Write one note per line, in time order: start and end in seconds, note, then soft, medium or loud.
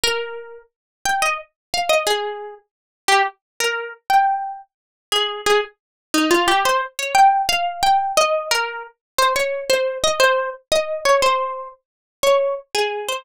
0.04 0.58 A#4 loud
1.05 1.22 G5 loud
1.22 1.37 D#5 loud
1.74 1.90 F5 loud
1.89 2.04 D#5 loud
2.07 2.54 G#4 loud
3.08 3.22 G4 loud
3.60 3.89 A#4 loud
4.10 4.57 G5 loud
5.12 5.41 G#4 loud
5.46 5.60 G#4 loud
6.14 6.30 D#4 loud
6.31 6.47 F4 loud
6.48 6.63 G4 loud
6.65 6.81 C5 loud
6.99 7.14 C#5 loud
7.15 7.42 G5 loud
7.49 7.81 F5 loud
7.83 8.12 G5 loud
8.17 8.48 D#5 loud
8.51 8.83 A#4 loud
9.18 9.33 C5 loud
9.36 9.64 C#5 loud
9.70 9.98 C5 loud
10.04 10.19 D#5 loud
10.20 10.50 C5 loud
10.72 11.00 D#5 loud
11.05 11.21 C#5 loud
11.22 11.68 C5 loud
12.23 12.55 C#5 loud
12.75 13.08 G#4 medium
13.09 13.25 C5 loud